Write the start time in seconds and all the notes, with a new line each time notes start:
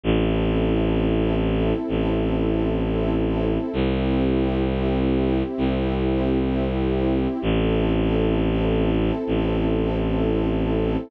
0.03 A1 C4 E4 A4
1.88 A1
3.73 C2 C4 E4 G4
5.58 C2
7.42 A1 C4 E4 A4
9.27 A1